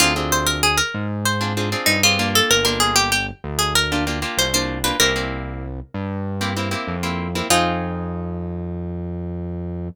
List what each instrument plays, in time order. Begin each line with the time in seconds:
0.00 synth bass 1 D2, acoustic guitar (steel) C4 D4 F4 G#4
0.16 acoustic guitar (steel) C4 D4 F4 G#4
0.32 acoustic guitar (steel) C5
0.46 acoustic guitar (steel) A#4
0.63 acoustic guitar (steel) G#4
0.77 acoustic guitar (steel) A#4
0.94 synth bass 1 G#2
1.25 acoustic guitar (steel) C5
1.41 acoustic guitar (steel) C4 D4 F4 G#4
1.57 acoustic guitar (steel) C4 D4 F4 G#4
1.72 acoustic guitar (steel) C4 D4 F4 G#4
1.86 synth bass 1 G2, acoustic guitar (steel) D#4
2.03 acoustic guitar (steel) C4 D4 F4 G#4
2.19 acoustic guitar (steel) A#3 D4 F4 G4
2.35 acoustic guitar (steel) A4
2.51 synth bass 1 G1, acoustic guitar (steel) A#4
2.65 acoustic guitar (steel) A#3 D4 F4 G4 A#4
2.80 acoustic guitar (steel) G#4
2.96 acoustic guitar (steel) G4
3.12 acoustic guitar (steel) G4
3.44 synth bass 1 D2
3.59 acoustic guitar (steel) G#4
3.75 acoustic guitar (steel) A#4
3.92 acoustic guitar (steel) A#3 D4 F4 G4
4.07 acoustic guitar (steel) A#3 D4 F4 G4
4.22 acoustic guitar (steel) A#3 D4 F4 G4
4.38 synth bass 1 C2, acoustic guitar (steel) C5
4.54 acoustic guitar (steel) A#3 D4 F4 G4 C5
4.84 acoustic guitar (steel) A#3 D4 F4 G4 B4
5.00 synth bass 1 C2, acoustic guitar (steel) A#3 C4 E4 G4 A#4
5.16 acoustic guitar (steel) A#3 C4 E4 G4
5.94 synth bass 1 G2
6.41 acoustic guitar (steel) A#3 C4 E4 G4
6.57 acoustic guitar (steel) A#3 C4 E4 G4
6.71 acoustic guitar (steel) A#3 C4 E4 G4
6.88 synth bass 1 F2
7.03 acoustic guitar (steel) A#3 C4 E4 G4
7.35 acoustic guitar (steel) A#3 C4 E4 G4
7.50 synth bass 1 F2, acoustic guitar (steel) C4 D#4 F4 G#4